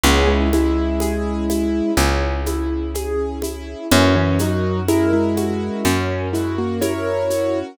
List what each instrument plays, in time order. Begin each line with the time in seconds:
0.03 electric bass (finger) C#2, acoustic grand piano B3 C#4 G#4, string ensemble 1 C#4 E4 G#4, low conga, shaker
0.27 acoustic grand piano G#3 E4
0.53 acoustic grand piano G#3 E4, high conga, shaker
1.00 acoustic grand piano G#4, high conga, shaker
1.50 acoustic grand piano E4, high conga, shaker
1.97 electric bass (finger) C#2, acoustic grand piano C#4, low conga, shaker
2.46 acoustic grand piano E4, high conga, shaker
2.95 acoustic grand piano G#4, high conga, shaker
3.42 acoustic grand piano E4, high conga, shaker
3.92 electric bass (finger) F#2, acoustic grand piano E3 C#4, string ensemble 1 C#4 F#4 A#4, low conga, shaker
4.16 acoustic grand piano E3 C#4
4.39 acoustic grand piano F#3 D#4 F#4, high conga, shaker
4.88 acoustic grand piano G#3 E4 A#4, high conga, shaker
5.13 acoustic grand piano G#3 E4
5.37 acoustic grand piano F#4, high conga, shaker
5.85 electric bass (finger) F#2, acoustic grand piano C#4, low conga, shaker
6.33 acoustic grand piano G#3 E4 F#4, shaker
6.58 acoustic grand piano A#3 F#4
6.81 acoustic grand piano E4 A#4 C#5, high conga, shaker
7.30 acoustic grand piano F#4, shaker